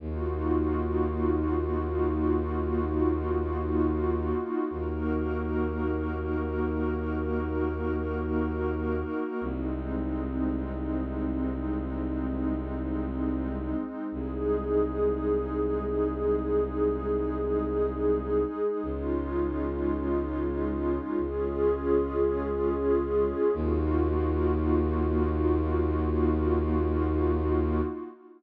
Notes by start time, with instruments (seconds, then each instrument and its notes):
0.00 violin D#2, pad 2 (warm) A#3 D#4 F4 F#4
4.70 violin D#2, pad 2 (warm) A#3 D#4 F#4 A#4
9.41 violin C2, pad 2 (warm) G#3 C4 D#4
14.12 violin C2, pad 2 (warm) G#3 D#4 G#4
18.82 violin C#2, pad 2 (warm) G#3 C#4 D#4 F4
21.17 violin C#2, pad 2 (warm) G#3 C#4 F4 G#4
23.53 violin D#2, pad 2 (warm) A#3 D#4 F4 F#4